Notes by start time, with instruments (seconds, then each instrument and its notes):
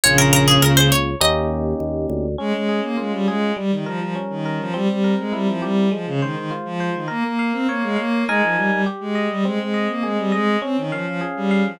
0.04 drawbar organ A#1, violin C#3, electric piano 1 A#3 C#4 F4, harpsichord C#5
0.18 harpsichord A#4
0.33 harpsichord A#4
0.48 harpsichord G#4
0.62 drawbar organ C#2, harpsichord A#4
0.77 harpsichord C5
0.92 harpsichord C#5
1.21 drawbar organ D#2, electric piano 1 A#3 C#4 D#4 G4, harpsichord D#5
1.80 drawbar organ D#2
2.10 drawbar organ D2
2.38 violin G#3, electric piano 1 C#4
2.53 violin G#3
2.69 electric piano 1 G#4
2.83 violin A#3
2.97 violin G#3, electric piano 1 F4
3.12 violin G3
3.27 violin G#3, electric piano 1 G#4
3.57 electric piano 1 G3, violin G3
3.71 violin D#3
3.86 violin F3, electric piano 1 A#4
4.00 violin F3
4.15 electric piano 1 C#4
4.30 violin D#3
4.46 electric piano 1 A#4
4.60 violin F3
4.74 violin G3, electric piano 1 C4
4.88 violin G3
5.04 electric piano 1 A#4
5.18 violin G#3
5.33 violin G3, electric piano 1 E4
5.47 violin F3
5.62 violin G3, electric piano 1 G4
5.91 violin F3, electric piano 1 G#3
6.06 violin C#3
6.21 violin D#3, electric piano 1 C5
6.36 violin D#3
6.51 electric piano 1 F4
6.65 violin F3
6.80 electric piano 1 C5
6.95 violin D#3
7.08 violin A#3, electric piano 1 A#4
7.24 violin A#3
7.39 electric piano 1 F5
7.53 violin C4
7.69 violin A#3, electric piano 1 C#5
7.83 violin G#3
7.96 violin A#3, electric piano 1 F5
8.28 violin G#3, electric piano 1 D#4 A#4 G#5
8.42 violin F3
8.56 violin G3
8.71 violin G3
8.86 electric piano 1 G4
9.00 violin G#3
9.15 electric piano 1 D#5
9.30 violin G3
9.45 violin G#3, electric piano 1 C4
9.59 violin G#3
9.74 electric piano 1 D#5
9.89 violin A#3
10.03 violin G#3, electric piano 1 G#4
10.18 violin G3
10.32 violin G#3, electric piano 1 D#5
10.62 violin C4, electric piano 1 C#4
10.77 violin D#3
10.92 violin F3, electric piano 1 F5
11.07 violin F3
11.21 electric piano 1 G#4
11.36 violin G3
11.51 electric piano 1 F5
11.65 violin F3